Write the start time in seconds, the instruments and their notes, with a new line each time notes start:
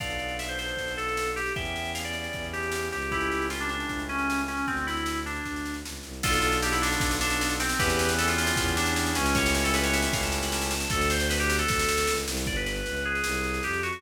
0.00 violin B1, drawbar organ B3 D4 F4 A4, electric piano 2 D5 F5, kick, snare, crash
0.10 snare
0.19 snare
0.28 snare
0.39 electric piano 2 E5, snare
0.49 electric piano 2 C5, snare
0.59 electric piano 2 C5, snare
0.68 snare
0.77 violin B1, kick, snare
0.88 snare
0.97 electric piano 2 A4, snare
1.08 snare
1.17 snare
1.27 snare
1.36 electric piano 2 G4, snare
1.46 snare
1.56 violin E2, drawbar organ B3 C#4 E4 G4, electric piano 2 E5 G5, kick, snare
1.65 snare
1.76 snare
1.85 snare
1.95 electric piano 2 F5, snare
2.05 electric piano 2 D5, snare
2.13 electric piano 2 D5, snare
2.24 snare
2.33 violin E2, kick, snare
2.43 kick, snare
2.53 electric piano 2 G4, snare
2.63 snare
2.72 snare
2.83 snare
2.92 violin C#2, electric piano 2 G4, snare
3.02 snare
3.12 drawbar organ A3 C#4 E4 G4, electric piano 2 E4 G4, kick, snare
3.20 snare
3.32 snare
3.42 snare
3.50 electric piano 2 F4, snare
3.60 electric piano 2 D4, snare
3.69 electric piano 2 D4, snare
3.80 snare
3.89 violin C#2, kick, snare
3.99 snare
4.09 electric piano 2 C#4, snare
4.18 snare
4.30 snare
4.39 snare
4.48 electric piano 2 C#4, snare
4.57 snare
4.67 violin D2, electric piano 2 C4, kick, snare
4.77 snare
4.87 electric piano 2 E4, snare
4.97 snare
5.06 snare
5.16 snare
5.26 electric piano 2 D4, snare
5.35 snare
5.45 violin D2, kick, snare
5.56 snare
5.66 snare
5.74 snare
5.85 violin C#2, snare
5.95 snare
6.03 violin C2, snare
6.13 snare
6.23 violin B1, drawbar organ B3 D4 F4 A4, electric piano 2 F4 A4, kick, snare, crash
6.33 snare
6.42 snare
6.52 snare
6.62 electric piano 2 G4, snare
6.72 electric piano 2 E4, snare
6.82 electric piano 2 D4, snare
6.92 snare
7.00 violin B1, kick, snare
7.11 snare
7.21 electric piano 2 D4, snare
7.30 snare
7.41 snare
7.50 snare
7.60 electric piano 2 C4, snare
7.69 snare
7.79 violin E2, drawbar organ B3 C#4 E4 G4, electric piano 2 G4 B4, kick, snare
7.89 snare
7.99 snare
8.09 snare
8.18 electric piano 2 A4, snare
8.28 electric piano 2 F4, snare
8.38 electric piano 2 F4, snare
8.47 snare
8.56 violin E2, kick, snare
8.67 kick, snare
8.77 electric piano 2 D4, snare
8.86 snare
8.96 snare
9.06 snare
9.15 violin C#2, electric piano 2 C#4, snare
9.26 snare
9.35 drawbar organ A3 C#4 E4 G4, electric piano 2 C#5, kick, snare
9.46 snare
9.55 electric piano 2 C#5, snare
9.64 electric piano 2 A4, snare
9.74 electric piano 2 B4, snare
9.84 electric piano 2 C#5, snare
9.93 electric piano 2 E5, snare
10.02 snare
10.13 violin C#2, electric piano 2 F5, kick, snare
10.23 electric piano 2 A5, snare
10.32 snare
10.42 electric piano 2 B5, snare
10.52 electric piano 2 A5, snare
10.61 electric piano 2 A5, snare
10.71 snare
10.78 electric piano 2 A5, snare
10.90 violin D2, electric piano 2 A4, kick, snare
11.01 snare
11.10 electric piano 2 C5, snare
11.20 snare
11.30 electric piano 2 B4, snare
11.40 electric piano 2 G4, snare
11.50 snare
11.59 electric piano 2 A4, snare
11.68 violin D2, kick, snare
11.79 snare
11.89 snare
11.98 snare
12.07 violin C#2, snare
12.17 snare
12.27 violin C2, snare
12.37 snare
12.46 violin G1, electric piano 2 D5, kick, snare
12.56 electric piano 2 B4, snare
12.66 electric piano 2 B4, snare
12.76 snare
12.86 violin C#2, snare
12.96 snare
13.05 electric piano 2 G#4
13.15 snare
13.24 violin C2, snare
13.35 snare
13.44 snare
13.54 snare
13.63 violin F2, electric piano 2 G4, snare
13.73 snare
13.83 electric piano 2 F#4, snare
13.93 electric piano 2 F#4, snare